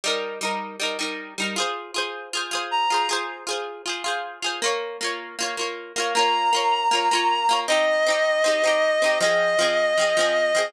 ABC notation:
X:1
M:4/4
L:1/8
Q:1/4=157
K:Fm
V:1 name="Clarinet"
z8 | z6 b2 | z8 | z8 |
b8 | e8 | e8 |]
V:2 name="Pizzicato Strings"
[G,EB]2 [G,EB]2 [G,EB] [G,EB]2 [G,EB] | [FAc]2 [FAc]2 [FAc] [FAc]2 [FAc] | [FAc]2 [FAc]2 [FAc] [FAc]2 [FAc] | [B,Fd]2 [B,Fd]2 [B,Fd] [B,Fd]2 [B,Fd] |
[B,Fd]2 [B,Fd]2 [B,Fd] [B,Fd]2 [B,Fd] | [CEG]2 [CEG]2 [CEG] [CEG]2 [CEG] | [F,CA]2 [F,CA]2 [F,CA] [F,CA]2 [F,CA] |]